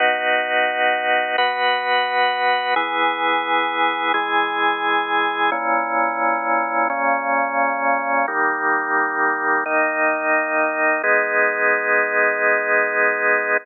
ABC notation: X:1
M:4/4
L:1/8
Q:1/4=87
K:G#m
V:1 name="Drawbar Organ"
[B,DF]4 [B,FB]4 | [E,B,G]4 [E,G,G]4 | [A,,E,C]4 [A,,C,C]4 | [D,=G,A,]4 [D,A,D]4 |
[G,B,D]8 |]